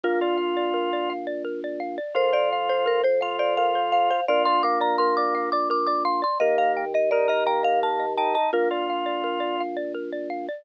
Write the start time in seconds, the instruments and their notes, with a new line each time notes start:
0.03 drawbar organ A#1 A#3, marimba F4, xylophone A#4
0.21 drawbar organ F4, xylophone D5
0.38 xylophone F5
0.57 xylophone D5
0.74 xylophone A#4
0.93 xylophone D5
1.10 xylophone F5
1.27 xylophone D5
1.45 xylophone A#4
1.64 xylophone D5
1.80 xylophone F5
1.98 xylophone D5
2.15 drawbar organ F2 F4, xylophone A#4, marimba C5
2.33 xylophone C5, marimba D5
2.53 xylophone F5
2.69 xylophone C5, marimba C5
2.86 xylophone A#4, marimba A#4
3.03 xylophone C5, marimba C5
3.21 drawbar organ F4, xylophone F5, marimba F5
3.39 xylophone C5, marimba D5
3.57 xylophone A#4, marimba F5
3.75 xylophone C5
3.92 marimba F5, xylophone F5
4.10 xylophone C5, marimba F5
4.28 drawbar organ A#1 F4, xylophone A#4, marimba D5
4.45 xylophone D5, marimba C6
4.63 drawbar organ A#3, xylophone F5, marimba D6
4.81 xylophone D5, marimba A#5
4.98 xylophone A#4, marimba C6
5.17 xylophone D5, marimba D6
5.35 xylophone F5
5.52 xylophone D5, marimba D6
5.70 xylophone A#4, marimba D6
5.87 xylophone D5, marimba D6
6.05 xylophone F5, marimba C6
6.22 xylophone D5, marimba C6
6.40 drawbar organ D#2 A#3, xylophone A#4, marimba D#5
6.58 xylophone D#5, marimba F5
6.77 xylophone G5
6.94 xylophone D#5, marimba D#5
7.11 drawbar organ D#4, xylophone A#4, marimba D5
7.28 drawbar organ A#4, marimba D#5, xylophone D#5
7.46 drawbar organ A#3, xylophone G5, marimba A#5
7.63 xylophone D#5, marimba F5
7.83 xylophone A#4, marimba A5
7.99 xylophone D#5
8.17 drawbar organ D#4, xylophone G5, marimba A5
8.34 xylophone D#5, marimba A5
8.53 drawbar organ A#1 A#3, marimba F4, xylophone A#4
8.71 drawbar organ F4, xylophone D5
8.90 xylophone F5
9.06 xylophone D5
9.24 xylophone A#4
9.40 xylophone D5
9.60 xylophone F5
9.77 xylophone D5
9.94 xylophone A#4
10.12 xylophone D5
10.30 xylophone F5
10.49 xylophone D5